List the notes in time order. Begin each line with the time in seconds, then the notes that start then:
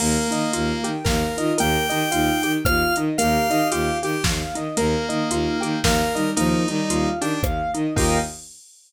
0.00 D#2 A#3 A#4, crash
0.31 D#3 D#4 D#5, closed hi-hat
0.52 D#2 A#3 F4 F5, closed hi-hat
0.84 D#3 G4 G5, closed hi-hat
1.04 D#2 A#3 A#4 F5, kick, snare
1.37 D#3 D#4 F4 D#5, closed hi-hat
1.58 D#2 A#3 G4 A#4 G5, closed hi-hat
1.89 D#3 D#4 D#5, closed hi-hat
2.11 D#2 D#4 F4 F5, closed hi-hat
2.43 D#3 G4 G5, closed hi-hat
2.65 D#2 A#3 F4 F5 F6, kick, cross-stick
2.96 D#3 D#4 D#5, closed hi-hat
3.18 D#2 A#3 G4 A#4 F5, closed hi-hat
3.49 D#3 D#4 G4 D#5, closed hi-hat
3.71 D#2 F4 G4 F5, closed hi-hat
4.03 D#3 G4 G5, closed hi-hat
4.24 D#2 A#3 F5, kick, snare
4.55 D#3 D#4 D#5, closed hi-hat
4.77 D#2 A#3 A#4, closed hi-hat
5.09 D#3 D#4 D#5, closed hi-hat
5.30 D#2 D#4 F4 F5, closed hi-hat
5.61 D#3 G4 G5, closed hi-hat
5.84 D#2 A#3 A#4 F5, kick, snare
6.14 D#3 G3 D#4 D#5, closed hi-hat
6.36 D#2 F3 A#3 D#4 A#4, closed hi-hat
6.68 D#3 G3 D#4 D#5, closed hi-hat
6.89 D#2 F4 F5, closed hi-hat
7.21 D#3 D4 G4 G5, closed hi-hat
7.43 D#2 A#3 F5, kick, cross-stick
7.74 D#3 D#4 D#5, closed hi-hat
7.95 D#2 A#3 D#4 F4 G4 A#4 D#5 F5 G5, kick, crash